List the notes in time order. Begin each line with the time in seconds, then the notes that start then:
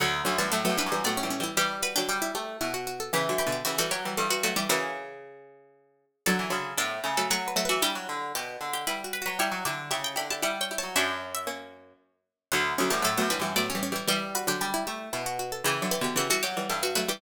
0.00 D2 D3 F#3 F#5
0.25 D2 D3 F#3 C#4
0.38 F#2 E3 G3 A3 A5
0.52 A2 F#3 A3 A4
0.65 F#3 A3 B3
0.69 F#2
0.77 E3 G3 D4 B4
0.86 F#2
0.92 E3 G3
1.04 A2 F#3 A3 B3 D5
1.17 C#4
1.23 E3 G3
1.30 C#4
1.40 E3 G3 E4
1.57 E3 G3 G4
1.82 F#4 B4
1.96 D3 F#3 D4 G4
2.09 G3 D4 G4
2.22 E4
2.35 A3 G4
2.61 B2 E4
2.74 F#4
2.87 F#4
3.00 A4
3.13 C#3 E3 G4
3.29 D3 F#3
3.38 G4 B4
3.47 B2 D3
3.52 G4
3.65 C#3 E3 F#4 G4
3.78 E3 G3 F#4 A4
3.91 F#3 G4 C#5
4.05 E3 G3
4.17 G2 E3 G3 A4
4.30 F#4 B4
4.43 F#3 A3 F#4 B4
4.56 E3 G3 G4 D5
4.69 C#3 E3 F#4 A#4
6.26 D3 F#3 A4 D5
6.39 E3
6.50 C#3 D3 F#3
6.77 A2 B3 D4 A4
7.04 C#3 A3 C#4
7.17 F#3 A3 A4
7.30 F#3 A3 F#4 C#5
7.48 B4
7.56 F#3 A3 F#4
7.65 E3 B4
7.69 F#4
7.82 G3 D4 E4 G4
7.95 F#3
8.09 D3
8.35 B2 G4
8.61 D3
8.73 G4
8.87 G3 E4 B4
9.04 F#4
9.13 B4
9.22 F#4
9.26 F#3 B4
9.39 G3 E4 G4 C#5 E5
9.52 F#3
9.65 D3 E4 G4 D5
9.91 C#3 E4 G4 E5
10.04 G5
10.16 D3 E4 G4 B5
10.30 E4 G4 A5
10.42 G3 E4 G4 D5 F#5
10.61 C#5 G5
10.71 E4 G4
10.78 C#5 A5
10.83 F#3
10.96 F#2 C#4 D4 F#4 E5
11.35 E5
11.47 A#3 C#4
12.52 D2 D3 F#3 F#5
12.78 D2 D3 F#3 C#4
12.90 F#2 E3 G3 A3 A5
13.02 A2 F#3 A3 A4
13.17 F#2 F#3 A3 B3
13.30 E3 G3 D4 B4
13.39 F#2 E3 G3
13.56 A2 F#3 A3 B3 D5
13.70 C#4
13.75 E3 G3
13.83 C#4
13.92 E3 G3 E4
14.07 E3 G3 G4
14.35 F#4 B4
14.47 D3 F#3 D4 G4
14.61 G3 D4 G4
14.74 E4
14.87 A3 G4
15.13 B2 E4
15.26 F#4
15.39 F#4
15.52 A4
15.64 C#3 E3 G4
15.82 D3 F#3
15.91 G4 B4
16.01 B2 D3 G4
16.16 C#3 E3 F#4 G4
16.30 E3 G3 F#4 A4
16.43 F#3 G4 C#5
16.57 E3 G3
16.69 G2 E3 G3 A4
16.83 F#4 B4
16.95 F#3 A3 F#4 B4
17.08 E3 G3 G4 D5